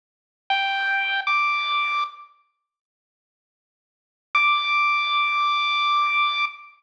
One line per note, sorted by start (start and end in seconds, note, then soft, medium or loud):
0.50 1.20 G5 medium
1.27 2.04 D6 medium
4.35 6.45 D6 loud